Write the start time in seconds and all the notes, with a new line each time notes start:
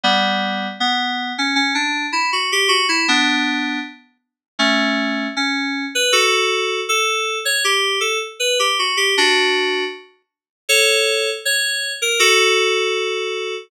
0.03 G3 B3
0.80 B3
1.38 C#4
1.56 C#4
1.75 D4
2.13 E4
2.32 F#4
2.52 G4
2.68 F#4
2.89 E4
3.08 B3 D4
4.59 A3 C#4
5.36 C#4
5.95 B4
6.12 F#4 A4
6.89 A4
7.45 C#5
7.64 G4
8.00 A4
8.40 B4
8.59 G4
8.79 F#4
8.97 G4
9.18 D4 F#4
10.69 A4 C#5
11.45 C#5
12.02 A#4
12.19 F#4 A4